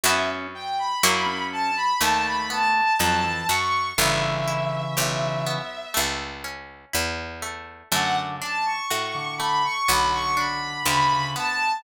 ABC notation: X:1
M:4/4
L:1/16
Q:1/4=61
K:Bm
V:1 name="Violin"
e z g b3 a b a b a2 a2 c'2 | e10 z6 | f z a c'3 b c' b c' b2 b2 a2 |]
V:2 name="Drawbar Organ"
C2 z3 C2 z A,4 F, E, z2 | [C,E,]8 z8 | D,2 z3 D,2 z D,4 C, C, z2 |]
V:3 name="Acoustic Guitar (steel)"
[B,CEF]4 [^A,CEF]4 =A,2 B,2 ^D2 F2 | B,2 E2 G2 B,2 A,2 C2 E2 A,2 | A,2 D2 F2 A,2 B,2 D2 G2 B,2 |]
V:4 name="Harpsichord" clef=bass
F,,4 F,,4 ^D,,4 =F,,2 ^F,,2 | G,,,4 B,,,4 C,,4 E,,4 | F,,4 A,,4 B,,,4 D,,4 |]